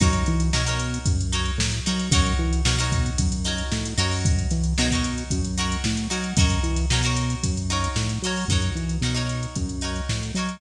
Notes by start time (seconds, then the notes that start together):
0.00 F#2 D#4 F#4 A#4 C#5, kick, closed hi-hat
0.13 closed hi-hat
0.26 E3, snare, closed hi-hat
0.40 closed hi-hat
0.53 B2 D#4 F#4 A#4 C#5, snare
0.66 D#4 F#4 A#4 C#5, closed hi-hat
0.80 closed hi-hat
0.94 closed hi-hat
1.06 F#2, kick, closed hi-hat
1.20 closed hi-hat
1.32 D#4 F#4 A#4 C#5, closed hi-hat
1.46 closed hi-hat
1.58 A2, snare
1.72 snare, closed hi-hat
1.86 F#3 D#4 F#4 A#4 C#5, closed hi-hat
1.99 closed hi-hat
2.12 F#2 D#4 F#4 A#4 C#5, kick, closed hi-hat
2.26 closed hi-hat
2.39 E3
2.53 closed hi-hat
2.65 B2 D#4 F#4 A#4 C#5, snare
2.79 D#4 F#4 A#4 C#5, closed hi-hat
2.92 kick, closed hi-hat
3.06 snare, closed hi-hat
3.18 F#2, kick, closed hi-hat
3.32 closed hi-hat
3.44 D#4 F#4 A#4 C#5, snare, closed hi-hat
3.58 closed hi-hat
3.72 A2, snare
3.85 closed hi-hat
3.98 F#2 D#4 F#4 A#4 C#5, closed hi-hat
4.11 snare, open hi-hat
4.25 kick, closed hi-hat
4.39 closed hi-hat
4.51 E3, snare, closed hi-hat
4.64 closed hi-hat
4.78 B2 D#4 F#4 A#4 C#5, snare
4.91 D#4 F#4 A#4, kick, closed hi-hat
4.95 C#5
5.03 snare, closed hi-hat
5.18 closed hi-hat
5.30 F#2, kick, closed hi-hat
5.45 closed hi-hat
5.58 D#4 F#4 A#4 C#5, snare, closed hi-hat
5.72 closed hi-hat
5.84 A2, snare
5.97 closed hi-hat
6.10 F#3 D#4 F#4 A#4 C#5, closed hi-hat
6.24 closed hi-hat
6.37 F#2 D#4 F#4 A#4 C#5, kick, closed hi-hat
6.50 closed hi-hat
6.63 E3, closed hi-hat
6.76 snare, closed hi-hat
6.90 B2 D#4 F#4 A#4 C#5, snare
7.03 D#4 F#4 A#4 C#5, snare, closed hi-hat
7.16 closed hi-hat
7.30 closed hi-hat
7.43 F#2, kick, closed hi-hat
7.57 closed hi-hat
7.70 D#4 F#4 A#4 C#5, closed hi-hat
7.84 closed hi-hat
7.96 A2, snare
8.09 snare, closed hi-hat
8.22 F#3 D#4 F#4 A#4, closed hi-hat
8.27 C#5
8.36 open hi-hat
8.48 F#2 D#4 F#4 A#4, kick, closed hi-hat
8.53 C#5
8.62 closed hi-hat
8.75 E3, snare, closed hi-hat
8.89 closed hi-hat
9.01 B2 D#4 F#4 A#4, snare
9.06 C#5
9.14 D#4 F#4 A#4 C#5, closed hi-hat
9.29 closed hi-hat
9.43 closed hi-hat
9.56 F#2, kick, closed hi-hat
9.69 closed hi-hat
9.81 D#4 F#4 A#4 C#5, closed hi-hat
9.96 closed hi-hat
10.09 A2, snare
10.21 snare, closed hi-hat
10.34 F#3 D#4 F#4 A#4, closed hi-hat
10.39 C#5
10.49 closed hi-hat